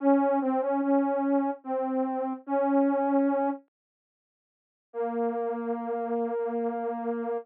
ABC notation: X:1
M:3/4
L:1/16
Q:1/4=73
K:Bbm
V:1 name="Ocarina"
D2 C D D4 C4 | D6 z6 | B,12 |]